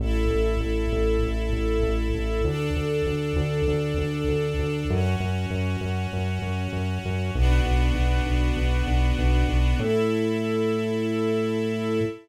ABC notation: X:1
M:4/4
L:1/8
Q:1/4=98
K:A
V:1 name="String Ensemble 1"
[EA]8 | [DA]8 | [CF]8 | [B,DF]8 |
[EA]8 |]
V:2 name="Synth Bass 1" clef=bass
A,,, A,,, A,,, A,,, A,,, A,,, A,,, A,,, | D,, D,, D,, D,, D,, D,, D,, D,, | F,, F,, F,, F,, F,, F,, F,, F,, | B,,, B,,, B,,, B,,, B,,, B,,, B,,, B,,, |
A,,8 |]